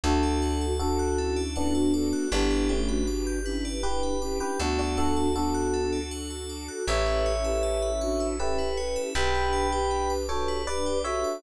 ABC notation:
X:1
M:3/4
L:1/16
Q:1/4=79
K:Amix
V:1 name="Electric Piano 1"
[FA]4 [FA]4 [B,D]4 | [B,D]2 [A,C]2 z4 [GB]3 [GB] | [DF] [DF] [FA]2 [FA]4 z4 | [ce]8 [GB]4 |
[gb]6 [Ac]2 [Bd]2 [ce]2 |]
V:2 name="Flute"
[DF]4 [DF]2 [CE]2 [CE] [DF] [FA]2 | [EG]3 [DF]3 [CE]2 [EG]2 [CE]2 | [B,D]4 [B,D]4 z4 | [GB]3 [GB]3 [DF]2 [ce]2 [GB]2 |
[GB]3 [GB]3 [FA]2 [GB]2 [FA]2 |]
V:3 name="Tubular Bells"
A d f a d' f' A d f a d' f' | B d g b d' g' B d g b d' g' | A d f a d' f' A d f a d' f' | A B c e a b c' e' A B c e |
G B d g b d' G B d g b d' |]
V:4 name="Electric Bass (finger)" clef=bass
D,,12 | G,,,12 | D,,12 | A,,,12 |
B,,,12 |]
V:5 name="String Ensemble 1"
[DFA]12 | [DGB]12 | [DFA]12 | [CEAB]12 |
[DGB]12 |]